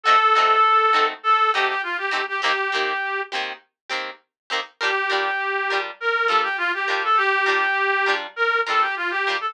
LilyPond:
<<
  \new Staff \with { instrumentName = "Clarinet" } { \time 4/4 \key g \minor \tempo 4 = 101 a'2 a'8 g'16 g'16 f'16 g'8 g'16 | g'4. r2 r8 | g'2 bes'8 a'16 g'16 f'16 g'8 a'16 | g'2 bes'8 a'16 g'16 f'16 g'8 a'16 | }
  \new Staff \with { instrumentName = "Pizzicato Strings" } { \time 4/4 \key g \minor <a c' ees' ges'>8 <a c' ees' ges'>4 <a c' ees' ges'>4 <a c' ees' ges'>4 <a c' ees' ges'>8 | <ees bes c' g'>8 <ees bes c' g'>4 <ees bes c' g'>4 <ees bes c' g'>4 <ees bes c' g'>8 | <g d' f' bes'>8 <g d' f' bes'>4 <g d' f' bes'>4 <g d' f' bes'>4 <g d' f' bes'>8~ | <g d' f' bes'>8 <g d' f' bes'>4 <g d' f' bes'>4 <g d' f' bes'>4 <g d' f' bes'>8 | }
>>